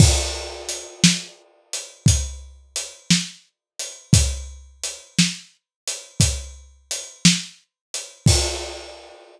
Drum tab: CC |x-----------|------------|x-----------|
HH |--x--xx-x--x|x-x--xx-x--x|------------|
SD |---o-----o--|---o-----o--|------------|
BD |o-----o-----|o-----o-----|o-----------|